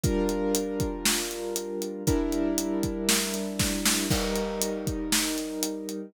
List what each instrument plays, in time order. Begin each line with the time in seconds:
0.03 acoustic grand piano G3 D4 F4 A#4, kick, closed hi-hat
0.29 closed hi-hat
0.55 closed hi-hat
0.80 kick, closed hi-hat
1.06 snare
1.31 closed hi-hat
1.56 closed hi-hat
1.82 closed hi-hat
2.07 acoustic grand piano G3 D4 E4 A#4, kick, closed hi-hat
2.32 closed hi-hat
2.58 closed hi-hat
2.83 kick, closed hi-hat
3.09 snare
3.34 closed hi-hat
3.59 kick, snare
3.85 snare
4.10 acoustic grand piano G3 D#4 A#4, kick, crash
4.36 closed hi-hat
4.62 closed hi-hat
4.87 kick, closed hi-hat
5.12 snare
5.38 closed hi-hat
5.63 closed hi-hat
5.89 closed hi-hat